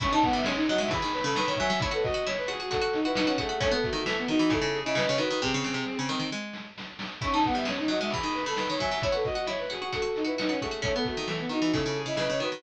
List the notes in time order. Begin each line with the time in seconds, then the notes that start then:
0.00 C#4 E4 C#6, kick, crash
0.11 D#4 A5
0.22 B3 F#5, kick, closed hi-hat
0.33 G3 E5
0.44 G#3 C#4, snare
0.55 D#4
0.67 F#3 F#4 D#5, closed hi-hat
0.78 G#3 E5
0.88 E3 G#4 B5, kick, closed hi-hat
1.02 D#3
1.12 B4, closed hi-hat
1.23 C#3 A4 B5
1.35 D#3 B4, snare
1.47 D#3 C#5
1.56 F#3 E5 G#5, kick, open hi-hat
1.70 F#3
1.80 E4 C#5, kick, closed hi-hat
1.91 F#4 A4 B4
2.02 F#4 D#5, kick, closed hi-hat
2.14 F#4
2.26 E4 C#5, snare
2.37 B4
2.47 F#4 G#4, closed hi-hat
2.59 F#4
2.71 F#4 A4, kick, closed hi-hat
2.81 F#4
2.93 D#4, closed hi-hat
3.04 E4 F#4 B4
3.15 D#4 F#4, snare
3.26 C#4 F#4
3.37 A3 F#4 G#4, kick, closed hi-hat
3.49 F#4
3.60 A3 C#4 C#5, kick, closed hi-hat
3.71 B3 A4
3.83 A3 F#4, kick, closed hi-hat
3.93 D#3 F#4
4.06 E3 A3, snare
4.17 B3
4.28 D#3 D#4 F#4, closed hi-hat
4.39 E3 F#4
4.50 C#3 E4 A4, kick, closed hi-hat
4.62 C#3
4.73 G#4, closed hi-hat
4.85 C#3 E4 D#5
4.95 C#3 B4, snare
5.07 C#3 C#5
5.17 D#3 F#4 B4, closed hi-hat
5.30 D#3
5.41 C3 C4 G#4, kick, snare
5.54 C#3
5.64 C#3, snare
5.74 C3
5.85 snare
5.99 C#3
6.09 D#3, snare
6.19 D#3
6.32 G#3
6.53 snare
6.78 snare
6.99 snare
7.21 C#4 E4 C#6, kick, crash
7.32 D#4 A5
7.44 B3 F#5, kick, closed hi-hat
7.55 G3 E5
7.65 G#3 C#4, snare
7.78 D#4
7.88 F#3 F#4 D#5, closed hi-hat
8.01 G#3 E5
8.10 E3 G#4 B5, kick, closed hi-hat
8.23 D#3
8.34 B4, closed hi-hat
8.45 C#3 A4 B5
8.56 D#3 B4, snare
8.69 D#3 C#5
8.78 F#3 E5 G#5, kick, open hi-hat
8.91 F#3
9.02 E4 C#5, kick, closed hi-hat
9.12 F#4 A4 B4
9.24 F#4 D#5, kick, closed hi-hat
9.35 F#4
9.47 E4 C#5, snare
9.59 B4
9.70 F#4 G#4, closed hi-hat
9.81 F#4
9.92 F#4 A4, kick, closed hi-hat
10.02 F#4
10.16 D#4, closed hi-hat
10.25 E4 F#4 B4
10.38 D#4 F#4, snare
10.49 C#4 F#4
10.60 A3 F#4 G#4, kick, closed hi-hat
10.71 F#4
10.82 A3 C#4 C#5, kick, closed hi-hat
10.94 B3 A4
11.05 A3 F#4, kick, closed hi-hat
11.16 D#3 F#4
11.27 E3 A3, snare
11.39 B3
11.49 D#3 D#4 F#4, closed hi-hat
11.61 E3 F#4
11.72 C#3 E4 A4, kick, closed hi-hat
11.86 C#3
11.95 G#4, closed hi-hat
12.06 C#3 E4 D#5
12.16 C#3 B4, snare
12.30 C#3 C#5
12.40 D#3 F#4 B4, closed hi-hat
12.52 D#3